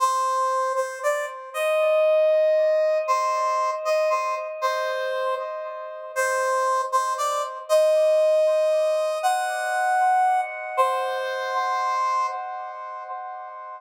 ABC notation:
X:1
M:6/8
L:1/8
Q:3/8=78
K:Cm
V:1 name="Brass Section"
c3 c d z | e6 | c3 e c z | c3 z3 |
c3 c d z | e6 | ^f5 z | c6 |]